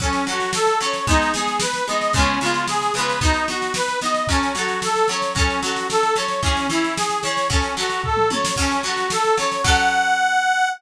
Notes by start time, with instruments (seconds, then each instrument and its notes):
0.00 acoustic guitar (steel) F#3 C#4 A4, accordion C#4, kick, snare
0.13 snare
0.27 acoustic guitar (steel) F#3 C#4 A4, accordion F#4, snare
0.40 snare
0.53 accordion A4, snare
0.67 snare
0.80 acoustic guitar (steel) F#3 C#4 A4, accordion C#5, snare
0.93 snare
1.07 acoustic guitar (steel) G#3 B3 D#4, accordion D#4, kick, snare
1.22 snare
1.34 acoustic guitar (steel) G#3 B3 D#4, accordion G#4, snare
1.47 snare
1.60 accordion B4, snare
1.74 snare
1.87 acoustic guitar (steel) G#3 B3 D#4, accordion D#5, snare
2.01 snare
2.13 acoustic guitar (steel) C#3 G#3, accordion C#4, kick, snare
2.18 acoustic guitar (steel) B3 F4
2.41 acoustic guitar (steel) C#3 G#3 B3, accordion F4, snare
2.46 acoustic guitar (steel) F4
2.54 snare
2.68 accordion G#4, snare
2.82 snare
2.94 acoustic guitar (steel) C#3 G#3, accordion B4, snare
2.98 acoustic guitar (steel) B3 F4
3.09 snare
3.21 acoustic guitar (steel) B3 D#4 F#4, accordion D#4, kick, snare
3.34 snare
3.48 acoustic guitar (steel) B3 D#4 F#4, accordion F#4, snare
3.62 snare
3.74 accordion B4, snare
3.88 snare
4.01 acoustic guitar (steel) B3 D#4, accordion D#5, snare
4.05 acoustic guitar (steel) F#4
4.14 snare
4.27 acoustic guitar (steel) F#3 C#4, accordion C#4, kick, snare
4.32 acoustic guitar (steel) A4
4.43 snare
4.55 acoustic guitar (steel) F#3 C#4, accordion F#4, snare
4.59 acoustic guitar (steel) A4
4.68 snare
4.82 accordion A4, snare
4.96 snare
5.08 acoustic guitar (steel) F#3 C#4, accordion C#5, snare
5.13 acoustic guitar (steel) A4
5.22 snare
5.35 acoustic guitar (steel) F#3 C#4, accordion C#4, kick, snare
5.39 acoustic guitar (steel) A4
5.50 snare
5.62 acoustic guitar (steel) F#3 C#4 A4, accordion F#4, snare
5.76 snare
5.90 accordion A4, snare
6.03 snare
6.16 acoustic guitar (steel) F#3 C#4 A4, accordion C#5, snare
6.28 snare
6.42 acoustic guitar (steel) E3 C#4 G#4, accordion C#4, kick, snare
6.57 snare
6.69 acoustic guitar (steel) E3 C#4 G#4, accordion E4, snare
6.84 snare
6.96 accordion G#4, snare
7.10 snare
7.23 acoustic guitar (steel) E3 C#4, accordion C#5, snare
7.27 acoustic guitar (steel) G#4
7.37 snare
7.50 acoustic guitar (steel) F#3 C#4 A4, accordion C#4, kick, snare
7.62 snare
7.77 acoustic guitar (steel) F#3 C#4 A4, accordion F#4, snare
7.90 snare
8.03 accordion A4, kick, floor tom
8.17 mid tom
8.30 acoustic guitar (steel) F#3 C#4 A4, accordion C#5, high tom
8.45 snare
8.56 acoustic guitar (steel) F#3 C#4, accordion C#4, kick, snare, crash
8.61 acoustic guitar (steel) A4
8.71 snare
8.83 acoustic guitar (steel) F#3 C#4, accordion F#4, snare
8.87 acoustic guitar (steel) A4
8.97 snare
9.10 accordion A4, snare
9.25 snare
9.37 acoustic guitar (steel) F#3 C#4 A4, accordion C#5, snare
9.52 snare
9.64 acoustic guitar (steel) F#3 C#4 A4, accordion F#5, kick, crash